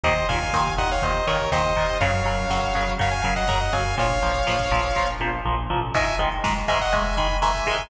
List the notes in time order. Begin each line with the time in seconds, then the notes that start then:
0.03 D#2 A#2 D#3 C5 D#5, kick, closed hi-hat
0.16 kick
0.29 D#2 A#2 D#3 F5 G#5, kick, closed hi-hat
0.41 kick
0.53 D#2 A#2 D#3, kick, snare
0.67 kick
0.77 D#2 A#2 D#3 D#5 F#5, kick, closed hi-hat
0.90 C#5 F5, kick
1.02 D#2 A#2 D#3 C5 D#5, kick, closed hi-hat
1.14 kick
1.27 D#2 A#2 D#3 A#4 C#5, kick, closed hi-hat
1.40 kick
1.51 D#2 A#2 D#3 C5 D#5, kick, snare
1.65 kick
1.76 D#2 A#2 D#3, kick, closed hi-hat
1.89 kick
2.01 F#2 C#3 F#3 C#5 F5, kick, closed hi-hat
2.13 kick
2.24 F#2 C#3 F#3 C#5 F5, kick, closed hi-hat
2.39 kick
2.49 F#2 C#3 F#3, kick, snare
2.61 kick
2.74 F#2 C#3 F#3, kick, closed hi-hat
2.88 kick
2.98 F#2 C#3 F#3 C#5 F5, kick, closed hi-hat
3.11 F5 G#5, kick
3.22 F#2 C#3 F#3 F5 G#5, kick, closed hi-hat
3.35 D#5 F#5, kick
3.48 F#2 C#3 F#3 F#5 A#5, kick, snare
3.61 D#5 F#5, kick
3.72 F#2 C#3 F#3 F5 G#5, kick, open hi-hat
3.85 kick
3.97 A#1 A#2 F3 C#5 F5, kick, closed hi-hat
4.10 kick
4.22 A#1 A#2 F3, kick, closed hi-hat
4.35 kick
4.47 A#1 A#2 F3, kick, snare
4.59 kick
4.71 A#1 A#2 F3, kick, closed hi-hat
4.84 kick
4.96 A#1 A#2 F3, kick, snare
5.20 A#1 A#2 F3, high tom
5.45 A#1 A#2 F3
5.70 A1 A#2 F3, floor tom
5.94 G#2 D#3 G#3 E5 G#5, kick, crash
6.07 kick, closed hi-hat
6.19 G#2 D#3 G#3, kick, closed hi-hat
6.32 kick, closed hi-hat
6.44 G#2 D#3 G#3, kick, snare
6.57 kick, closed hi-hat
6.68 G#2 D#3 G#3 E5 G#5, kick, closed hi-hat
6.80 D#5 F#5, kick, closed hi-hat
6.92 G#2 D#3 G#3 E5 G#5, kick, closed hi-hat
7.05 kick, closed hi-hat
7.17 G#2 D#3 G#3 G#5 B5, kick, closed hi-hat
7.30 kick, closed hi-hat
7.42 G#2 D#3 G#3 E5 G#5, kick, snare
7.55 kick, closed hi-hat
7.66 G#2 D#3 G#3, kick, closed hi-hat
7.78 kick, closed hi-hat